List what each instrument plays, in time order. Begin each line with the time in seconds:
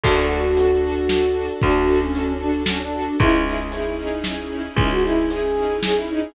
0.04 electric bass (finger) D2, string ensemble 1 D4 F#4 A4, flute F#4, kick, crash
0.30 string ensemble 1 D4 F#4 A4
0.57 string ensemble 1 D4 F#4 A4, closed hi-hat
0.83 string ensemble 1 D4 F#4 A4
1.09 string ensemble 1 D4 F#4 A4, snare
1.35 string ensemble 1 D4 F#4 A4
1.62 electric bass (finger) D2, string ensemble 1 D4 F#4 A4, flute F#4, kick, closed hi-hat
1.88 string ensemble 1 D4 F#4 A4
2.01 flute C#4
2.14 string ensemble 1 D4 F#4 A4, closed hi-hat
2.40 string ensemble 1 D4 F#4 A4, flute D4
2.66 flute C#4, string ensemble 1 D4 F#4 A4, snare
2.80 flute D4
2.93 string ensemble 1 D4 F#4 A4
3.20 electric bass (finger) C#2, string ensemble 1 C#4 D#4 E4 G#4, flute E4, kick, closed hi-hat
3.45 string ensemble 1 C#4 D#4 E4 G#4, flute E4
3.72 string ensemble 1 C#4 D#4 E4 G#4, flute E4, closed hi-hat
3.98 string ensemble 1 C#4 D#4 E4 G#4, flute D#4
4.24 string ensemble 1 C#4 D#4 E4 G#4, snare
4.51 string ensemble 1 C#4 D#4 E4 G#4
4.76 electric bass (finger) C#2, flute C#4, string ensemble 1 C#4 D#4 E4 G#4, kick, closed hi-hat
4.91 flute F#4
5.04 string ensemble 1 C#4 D#4 E4 G#4, flute E4
5.30 string ensemble 1 C#4 D#4 E4 G#4, flute G#4, closed hi-hat
5.56 string ensemble 1 C#4 D#4 E4 G#4
5.83 string ensemble 1 C#4 D#4 E4 G#4, flute G#4, snare
5.96 flute E4
6.09 string ensemble 1 C#4 D#4 E4 G#4, flute D#4